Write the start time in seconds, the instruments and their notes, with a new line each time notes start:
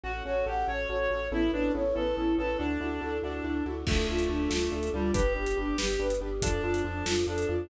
0.03 synth bass 2 A1, choir aahs A3 C#4 F#4, acoustic grand piano C#4 F#4 A4, clarinet F#4, flute F#4
0.25 synth bass 2 A1, acoustic grand piano C#4 F#4 A4, clarinet F#4, flute C#5
0.46 synth bass 2 A1, acoustic grand piano C#4 F#4 A4, clarinet G4, flute F#5
0.67 synth bass 2 A1, acoustic grand piano C#4 F#4 A4, clarinet C#5, flute C#5
0.89 synth bass 2 A1, acoustic grand piano C#4 F#4 A4, flute F#4
1.10 synth bass 2 A1, acoustic grand piano C#4 F#4 A4, flute C#5
1.31 synth bass 2 A1, choir aahs A3 B3 C#4 E4, acoustic grand piano B3 C#4 E4 A4, flute E4, clarinet E4
1.52 synth bass 2 A1, acoustic grand piano B3 C#4 E4 A4, clarinet D4, flute B4
1.74 synth bass 2 A1, acoustic grand piano B3 C#4 E4 A4, flute C#5
1.95 synth bass 2 A1, acoustic grand piano B3 C#4 E4 A4, clarinet A4, flute B4
2.17 synth bass 2 A1, acoustic grand piano B3 C#4 E4 A4, flute E4
2.38 synth bass 2 A1, acoustic grand piano B3 C#4 E4 A4, clarinet A4, flute B4
2.58 synth bass 2 D2, choir aahs A3 D4 E4 F#4, clarinet D4, flute D4, acoustic grand piano D4 E4 F#4 A4
2.80 synth bass 2 D2, acoustic grand piano D4 E4 F#4 A4, flute F#4
3.01 synth bass 2 D2, acoustic grand piano D4 E4 F#4 A4, flute A4
3.22 synth bass 2 D2, clarinet D4, acoustic grand piano D4 E4 F#4 A4, flute F#4
3.44 synth bass 2 D2, acoustic grand piano D4 E4 F#4 A4, flute D4
3.65 synth bass 2 D2, acoustic grand piano D4 E4 F#4 A4, flute F#4
3.86 synth bass 2 D2, clarinet A3, choir aahs A3 D4 F4, acoustic grand piano D4 F4 A4, flute A4, kick, crash
4.08 synth bass 2 D2, acoustic grand piano D4 F4 A4, flute F4
4.19 closed hi-hat
4.29 synth bass 2 D2, acoustic grand piano D4 F4 A4, flute D4
4.50 synth bass 2 D2, acoustic grand piano D4 F4 A4, flute F4, snare
4.72 synth bass 2 D2, acoustic grand piano D4 F4 A4, flute A4
4.83 closed hi-hat
4.94 synth bass 2 D2, clarinet G3, acoustic grand piano D4 F4 A4, flute F4
5.13 synth bass 2 G1, choir aahs G3 B3 D4, acoustic grand piano D4 G4 B4, clarinet G4, flute B4, kick, closed hi-hat
5.35 synth bass 2 G1, acoustic grand piano D4 G4 B4, flute G4
5.46 closed hi-hat
5.57 synth bass 2 G1, acoustic grand piano D4 G4 B4, flute D4
5.78 synth bass 2 G1, acoustic grand piano D4 G4 B4, flute G4, snare
5.99 synth bass 2 G1, acoustic grand piano D4 G4 B4, flute B4
6.10 closed hi-hat
6.20 synth bass 2 G1, acoustic grand piano D4 G4 B4, flute G4
6.41 synth bass 2 F2, choir aahs F3 A3 D4, clarinet D4, acoustic grand piano D4 F4 A4, flute A4, kick, closed hi-hat
6.62 synth bass 2 F2, acoustic grand piano D4 F4 A4, flute F4
6.74 closed hi-hat
6.84 synth bass 2 F2, acoustic grand piano D4 F4 A4, flute D4
7.06 synth bass 2 F2, acoustic grand piano D4 F4 A4, flute F4, snare
7.27 synth bass 2 F2, acoustic grand piano D4 F4 A4, clarinet D4, flute A4
7.38 closed hi-hat
7.48 synth bass 2 F2, acoustic grand piano D4 F4 A4, flute F4